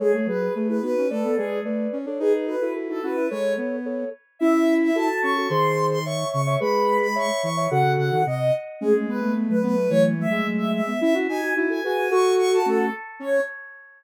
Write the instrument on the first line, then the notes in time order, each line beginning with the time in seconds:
ocarina
0.00 G#3 G#4 A4 C#5
0.14 A3 A4 C#5
0.26 F#3 G#4 B4
0.41 G#4 B4
0.55 A3 G#4 B4
0.69 E4 G#4 B4
0.82 B3 D#4 F#4 B4
0.98 C#4
1.10 A3 A4 B4 D5
1.24 B3
1.36 G#3 G#4 B4 D5
1.65 A3 B4 D5
1.93 C#4
2.06 D4 A4 C#5
2.19 D#4 G#4 B4
2.33 G#4 B4
2.47 F#4 A4 B4
2.62 E4 F#4 A4
2.75 F#4 A4
2.89 D#4 F#4 A4
3.03 C#4 E4 F#4 B4
3.16 E4
3.30 G#3 A4 C#5
3.57 B3
3.85 A4 C#5
4.39 C#4 E4 E5
4.83 E5
4.95 F#4 A4 A5
5.22 C#4 C#6
5.37 F#4 A4
5.48 D#3 G#4 C5 C6
5.91 C6
6.05 C#5 E5 C#6
6.32 C#3 C#6
6.47 C#5 E5
6.60 G#3 G#4 B4 B5
7.01 B5
7.15 C#5 E5 C#6
7.42 E3 C#6
7.57 C#5 E5
7.70 C#3 F#4 A4 F#5
7.85 C#3
7.98 C#3 F#5
8.12 D#3
8.26 C3 D#5
8.81 G#3 A3 C#4 G#4
8.94 A3 C#4
9.08 G#3 B3 B4
9.21 G#3 A3 B3
9.36 G#3 B3
9.49 F#3 A3 B4
9.63 F#3 A3 B3 B4
9.76 A3
9.90 E3 F#3 A3 C#5
10.18 F#3 A3 E5
10.31 G#3
10.46 F#3 A3
10.58 E5
10.74 E5
10.87 G#3 B3
11.01 C#4 E4 E5
11.14 C#4 E4 F#4
11.28 D#4 F#4 G#5
11.42 D#4 F#4
11.56 D#4 E4 F#4
11.70 F#4 A4 G#5
11.83 F#4 G#4 B4 G#5
11.97 F#4
12.11 F#4 A4 C#6
12.38 C#6
12.53 A5
12.66 A3 C#4 A4
13.20 C#4 C#5